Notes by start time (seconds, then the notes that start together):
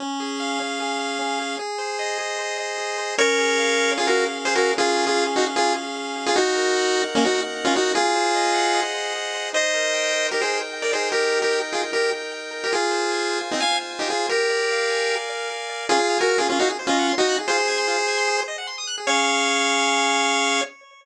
0.00 C#4
0.20 G#4
0.40 F5
0.60 C#4
0.80 G#4
0.99 F5
1.19 C#4
1.40 G#4
1.59 G#4
1.78 C5
1.99 D#5
2.18 G#4
2.38 C5
2.58 D#5
2.78 G#4
2.98 C5
3.18 C#4 A#4 C#5
3.38 G#4
3.58 F5
3.78 G#4
3.98 C#4 F4 G#4
4.07 F#4 A#4
4.17 G#4
4.37 F5
4.45 G#4 C5
4.55 F#4 G#4 A#4
4.77 C#4 F4 G#4
4.96 G#4
5.07 F4 G#4
5.17 F5
5.36 D#4 F#4 G#4
5.56 C#4 F4 G#4
5.76 G#4
5.96 F5
6.16 G#4
6.26 F4 G#4
6.36 D#4 F#4
6.55 A#4
6.76 F#5
6.95 A#4
7.15 A#3 C#4 D#4
7.25 D#4 F#4
7.35 A#4
7.55 F#5
7.65 C#4 F4
7.75 D#4 F#4 A#4
7.95 F4 G#4
8.15 C5
8.35 D#5
8.54 F#5
8.74 D#5
8.94 C5
9.14 G#4
9.34 C5
9.53 D#4 C5 D#5
9.74 A#4
9.94 G5
10.13 A#4
10.31 D#4 G4 A#4
10.42 G#4 C5
10.53 A#4
10.73 G5
10.82 A#4 D5
10.93 D#4 G#4 C5
11.12 G4 A#4
11.32 A#4
11.42 G4 A#4
11.52 G5
11.72 F4 G#4 A#4
11.92 D#4 G4 A#4
12.12 A#4
12.32 G5
12.51 A#4
12.64 G4 A#4
12.72 F4 G#4
12.91 C5
13.12 G#5
13.31 C5
13.51 C4 D#4 F4
13.60 F5 G#5
13.71 C5
13.91 G#5
13.99 D#4 G4
14.10 F4 G#4 C5
14.29 G4 A#4
14.50 D5
14.71 F5
14.90 G#5
15.10 F5
15.30 D5
15.50 A#4
15.69 D5
15.89 C#4 F4 G#4
15.99 G#4
16.10 F5
16.19 F#4 A#4 G#5
16.29 F6
16.38 C#4 F4 G#4
16.49 C#4 F4 G#4
16.59 D#4 F#4 F5
16.68 G#4
16.79 C5
16.87 C#4 F4 D#5
16.99 F#5
17.09 C6
17.18 D#4 F#4 D#6
17.29 F#6
17.38 G#4
17.48 F4 G#4 C5
17.58 C5
17.68 G#5
17.78 C6
17.88 F4
17.98 C5
18.08 G#5
18.18 C6
18.28 G#4
18.38 C5
18.48 D#5
18.58 F#5
18.67 C6
18.78 D#6
18.87 F#6
18.98 G#4
19.07 C#4 G#4 C#5 F5